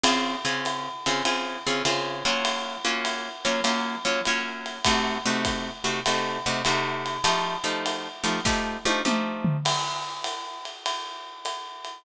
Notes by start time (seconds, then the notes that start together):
0.04 C#3 C4 F4 G#4, ride
0.45 C#3 C4 F4 G#4
0.65 hi-hat pedal, ride
1.06 C#3 C4 F4 G#4, ride
1.25 C#3 C4 F4 G#4, ride
1.67 C#3 C4 F4 G#4
1.85 C#3 C4 F4 G#4, hi-hat pedal, ride
2.25 F#3 A#3 C#4 F4, ride
2.45 ride
2.85 F#3 A#3 C#4 F4
3.05 hi-hat pedal, ride
3.45 F#3 A#3 C#4 F4, ride
3.64 F#3 A#3 C#4 F4, ride
4.05 F#3 A#3 C#4 F4
4.25 F#3 A#3 C#4 F4, hi-hat pedal, ride
4.66 ride
4.85 C3 A3 D#4 F#4, kick, ride
5.26 C3 A3 D#4 F#4
5.45 kick, hi-hat pedal, ride
5.84 C3 A3 D#4 F#4, ride
6.06 C3 A3 D#4 F#4, ride
6.46 C3 A3 D#4 F#4
6.65 C3 A3 D#4 F#4, hi-hat pedal, ride
7.06 ride
7.24 F3 A3 D#4 G4, ride
7.64 F3 A3 D#4 G4
7.86 hi-hat pedal, ride
8.24 F3 A3 D#4 G4, ride
8.45 F3 A3 D#4 G4, kick, snare
8.85 F3 A3 D#4 G4, high tom
9.05 F3 A3 D#4 G4, mid tom
9.45 floor tom
9.65 crash, ride
10.24 hi-hat pedal, ride
10.65 ride
10.86 ride
11.45 hi-hat pedal, ride
11.85 ride